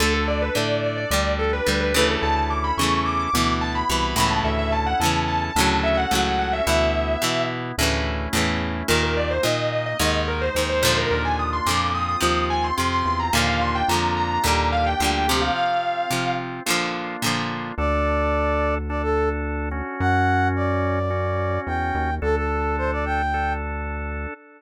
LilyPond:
<<
  \new Staff \with { instrumentName = "Distortion Guitar" } { \time 4/4 \key d \major \tempo 4 = 108 a'16 a'16 d''16 b'16 d''8 d''16 d''16 d''8 a'16 b'8 b'16 b'16 a'16 | a''16 a''16 d'''16 b''16 cis'''8 d'''16 d'''16 d'''8 a''16 b''8 b''16 b''16 a''16 | e''16 e''16 a''16 fis''16 a''8 a''16 a''16 a''8 e''16 fis''8 fis''16 fis''16 e''16 | e''4. r2 r8 |
\key ees \major bes'16 bes'16 d''16 c''16 ees''8 ees''16 ees''16 ees''8 bes'16 c''8 c''16 c''16 bes'16 | bes'16 aes''16 ees'''16 c'''16 d'''8 ees'''16 ees'''16 ees'''8 aes''16 c'''8 c'''16 c'''16 bes''16 | f''16 f''16 c'''16 g''16 bes''8 bes''16 bes''16 bes''8 f''16 g''8 g''16 g'16 f''16 | f''4. r2 r8 |
\key d \major r1 | r1 | r1 | }
  \new Staff \with { instrumentName = "Brass Section" } { \time 4/4 \key d \major r1 | r1 | r1 | r1 |
\key ees \major r1 | r1 | r1 | r1 |
\key d \major d''2 d''16 a'8 r4 r16 | fis''4 d''2 g''4 | a'16 a'8. c''16 d''16 g''4 r4. | }
  \new Staff \with { instrumentName = "Acoustic Guitar (steel)" } { \time 4/4 \key d \major <d a>4 <d a>4 <d g>4 <d g>8 <cis e a>8~ | <cis e a>4 <cis e a>4 <b, e>4 <b, e>8 <a, cis e>8~ | <a, cis e>4 <a, cis e>4 <a, cis fis>4 <a, cis fis>4 | <b, e>4 <b, e>4 <a, cis e>4 <a, cis e>4 |
\key ees \major <bes, ees>4 <bes, ees>4 <aes, ees>4 <aes, ees>8 <bes, d f>8~ | <bes, d f>4 <bes, d f>4 <c f>4 <c f>4 | <bes, d f>4 <bes, d f>4 <bes, d g>4 <bes, d g>8 <c f>8~ | <c f>4 <c f>4 <bes, d f>4 <bes, d f>4 |
\key d \major r1 | r1 | r1 | }
  \new Staff \with { instrumentName = "Drawbar Organ" } { \time 4/4 \key d \major <d' a'>2 <d' g'>2 | <cis' e' a'>2 <b e'>2 | <cis' e' a'>2 <cis' fis' a'>2 | <b e'>2 <a cis' e'>2 |
\key ees \major <bes ees'>2 <aes ees'>2 | <bes d' f'>4. <c' f'>2~ <c' f'>8 | <bes d' f'>2 <bes d' g'>2 | <c' f'>2 <bes d' f'>2 |
\key d \major <d' a'>2 <d' a'>4. <cis' fis'>8~ | <cis' fis'>2 <cis' fis'>2 | <d' a'>2 <d' a'>2 | }
  \new Staff \with { instrumentName = "Synth Bass 1" } { \clef bass \time 4/4 \key d \major d,4 a,4 d,4 d,4 | d,4 e,4 d,4 c,8 cis,8 | d,4 e,4 d,4 cis,4 | d,4 b,4 d,4 e,4 |
\key ees \major ees,4 bes,4 ees,4 ees,4 | ees,4 f,4 ees,4 f,8 e,8 | ees,4 f,4 ees,4 d,4 | r1 |
\key d \major d,1 | fis,2. e,8 dis,8 | d,1 | }
>>